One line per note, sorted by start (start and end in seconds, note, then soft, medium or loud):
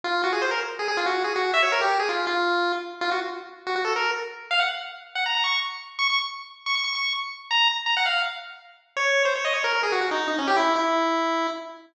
0.04 0.22 F4 loud
0.24 0.32 F#4 medium
0.33 0.41 G#4 medium
0.42 0.50 C5 medium
0.51 0.60 A#4 medium
0.79 0.88 G#4 medium
0.88 0.97 G#4 loud
0.97 1.06 F4 loud
1.06 1.23 F#4 medium
1.24 1.33 G#4 medium
1.36 1.51 F#4 medium
1.54 1.62 E5 loud
1.63 1.71 C#5 medium
1.72 1.81 A#4 medium
1.81 1.98 G4 medium
1.99 2.08 G#4 medium
2.09 2.25 F4 medium
2.27 2.72 F4 medium
3.01 3.10 F4 loud
3.11 3.20 F#4 medium
3.67 3.75 F#4 medium
3.76 3.84 F#4 medium
3.85 3.93 A4 medium
3.96 4.11 A#4 medium
4.51 4.60 F5 loud
4.60 4.69 F#5 medium
5.15 5.24 F#5 medium
5.26 5.34 A#5 medium
5.35 5.44 A#5 medium
5.44 5.60 C#6 medium
5.99 6.08 C#6 loud
6.10 6.19 C#6 medium
6.66 6.75 C#6 medium
6.75 6.84 C#6 medium
6.84 6.93 C#6 medium
6.95 7.13 C#6 medium
7.51 7.68 A#5 loud
7.86 7.95 A#5 medium
7.97 8.06 F#5 loud
8.06 8.22 F5 medium
8.97 9.23 C#5 loud
9.25 9.34 C5 medium
9.36 9.44 C#5 medium
9.45 9.53 D#5 medium
9.54 9.63 C#5 medium
9.64 9.73 A#4 loud
9.73 9.82 A#4 medium
9.83 9.92 G#4 medium
9.92 10.01 F#4 medium
10.01 10.10 F#4 medium
10.11 10.27 D#4 medium
10.28 10.36 D#4 medium
10.38 10.47 C#4 medium
10.47 10.56 G4 loud
10.56 10.74 E4 loud
10.76 11.47 E4 medium